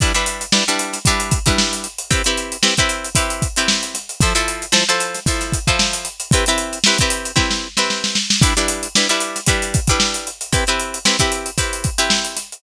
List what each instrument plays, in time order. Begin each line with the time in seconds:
0.00 pizzicato strings G3 D4 E4 B4, kick, closed hi-hat
0.14 pizzicato strings G3 D4 E4 B4, closed hi-hat
0.26 closed hi-hat
0.41 closed hi-hat
0.52 pizzicato strings G3 D4 E4 B4, snare
0.67 pizzicato strings G3 D4 E4 B4, snare, closed hi-hat
0.79 closed hi-hat
0.93 snare, closed hi-hat
1.05 pizzicato strings G3 D4 E4 B4, kick, closed hi-hat
1.20 closed hi-hat
1.31 kick, closed hi-hat
1.46 pizzicato strings G3 D4 E4 B4, kick, closed hi-hat
1.58 snare
1.73 closed hi-hat
1.84 closed hi-hat
1.98 closed hi-hat
2.11 pizzicato strings C4 E4 G4 B4, kick, closed hi-hat
2.24 pizzicato strings C4 E4 G4 B4, closed hi-hat
2.37 closed hi-hat
2.52 closed hi-hat
2.63 pizzicato strings C4 E4 G4 B4, snare
2.77 pizzicato strings C4 E4 G4 B4, kick, closed hi-hat
2.89 closed hi-hat
3.04 closed hi-hat
3.15 pizzicato strings C4 E4 G4 B4, kick, closed hi-hat
3.30 closed hi-hat
3.42 kick, closed hi-hat
3.56 pizzicato strings C4 E4 G4 B4, closed hi-hat
3.68 snare
3.83 closed hi-hat
3.94 snare, closed hi-hat
4.09 closed hi-hat
4.21 pizzicato strings F3 E4 A4 C5, kick, closed hi-hat
4.35 pizzicato strings F3 E4 A4 C5, closed hi-hat
4.48 closed hi-hat
4.62 closed hi-hat
4.72 pizzicato strings F3 E4 A4 C5, snare
4.89 pizzicato strings F3 E4 A4 C5, closed hi-hat
5.00 closed hi-hat
5.14 snare, closed hi-hat
5.26 pizzicato strings F3 E4 A4 C5, kick, closed hi-hat
5.41 snare, closed hi-hat
5.52 kick, closed hi-hat
5.67 pizzicato strings F3 E4 A4 C5, kick, closed hi-hat
5.79 snare
5.93 snare, closed hi-hat
6.05 closed hi-hat
6.20 closed hi-hat
6.31 pizzicato strings C4 E4 G4 B4, kick, closed hi-hat
6.46 pizzicato strings C4 E4 G4 B4, snare, closed hi-hat
6.58 closed hi-hat
6.73 closed hi-hat
6.84 pizzicato strings C4 E4 G4 B4, snare
6.98 pizzicato strings C4 E4 G4 B4, kick, snare, closed hi-hat
7.10 closed hi-hat
7.25 closed hi-hat
7.36 pizzicato strings C4 E4 G4 B4, kick, snare
7.51 snare
7.77 pizzicato strings C4 E4 G4 B4, snare
7.90 snare
8.04 snare
8.15 snare
8.30 snare
8.42 pizzicato strings G3 D4 E4 B4, kick, closed hi-hat
8.57 pizzicato strings G3 D4 E4 B4, closed hi-hat
8.68 closed hi-hat
8.83 closed hi-hat
8.95 pizzicato strings G3 D4 E4 B4, snare
9.09 pizzicato strings G3 D4 E4 B4, snare, closed hi-hat
9.20 closed hi-hat
9.36 snare, closed hi-hat
9.46 pizzicato strings G3 D4 E4 B4, kick, closed hi-hat
9.62 closed hi-hat
9.74 kick, closed hi-hat
9.87 pizzicato strings G3 D4 E4 B4, kick, closed hi-hat
10.00 snare
10.14 closed hi-hat
10.27 closed hi-hat
10.41 closed hi-hat
10.53 pizzicato strings C4 E4 G4 B4, kick, closed hi-hat
10.67 pizzicato strings C4 E4 G4 B4, closed hi-hat
10.79 closed hi-hat
10.94 closed hi-hat
11.05 pizzicato strings C4 E4 G4 B4, snare
11.19 pizzicato strings C4 E4 G4 B4, kick, closed hi-hat
11.32 closed hi-hat
11.46 closed hi-hat
11.58 pizzicato strings C4 E4 G4 B4, kick, closed hi-hat
11.73 closed hi-hat
11.84 kick, closed hi-hat
11.98 pizzicato strings C4 E4 G4 B4, closed hi-hat
12.10 snare
12.25 closed hi-hat
12.36 snare, closed hi-hat
12.52 closed hi-hat